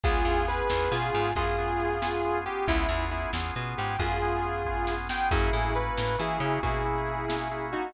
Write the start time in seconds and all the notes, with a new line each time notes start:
0.04 C#2 B3 C#4 F4 G#4, kick, closed hi-hat
0.25 E2 B3 C#4 F4 G#4, closed hi-hat
0.47 B3 C#4 F4 G#4 B4, closed hi-hat
0.70 E2 B3 C#4 F4 G#4, snare
0.91 B2 B3 C#4 F4 G#4, closed hi-hat
1.14 G#2, closed hi-hat
1.35 F#2 B3 C#4 F4 G#4, kick, closed hi-hat
1.58 B3 C#4 F4 G#4, closed hi-hat
1.80 closed hi-hat
2.02 B3 C#4 F4 G#4, snare
2.23 B3 C#4 F4 G#4, closed hi-hat
2.46 B3 C#4 F4 G4 G#4, open hi-hat
2.67 C#2 B3 C#4 E4 F4 G#4, kick, closed hi-hat
2.89 E2 B3 C#4 F4 G#4, closed hi-hat
3.11 B3 C#4 E4 F4 G#4, closed hi-hat
3.33 E2 B3 C#4 F4 G#4, snare
3.56 B2 B3 C#4 F4 G#4, closed hi-hat
3.78 G#2 G4, closed hi-hat
3.99 F#2 B3 C#4 F4 G#4, kick, closed hi-hat
4.21 B3 C#4 F4 G#4, closed hi-hat
4.44 closed hi-hat
4.65 B3 C#4 F4 G#4, kick
4.87 B3 C#4 F4 G#4, snare
5.09 B3 C#4 F4 G#4 G5, snare
5.31 F#2 A#3 C#4 E4 F#4 G#4, kick, crash
5.53 A2 A#3 C#4 E4 F#4, closed hi-hat
5.75 A#3 C#4 E4 F#4 B4, closed hi-hat
5.97 A2, snare
6.18 E3 A#3 C#4 E4 F#4 G#4, closed hi-hat
6.40 C#3 A#3 C#4 E4 F#4, closed hi-hat
6.63 B2 A#3 C#4 E4 F#4 G#4, kick, closed hi-hat
6.85 A#3 C#4 E4 F#4, closed hi-hat
7.07 closed hi-hat
7.28 A#3 C#4 E4 F#4, snare
7.51 A#3 C#4 E4 F#4, closed hi-hat
7.73 D#4 F#4, closed hi-hat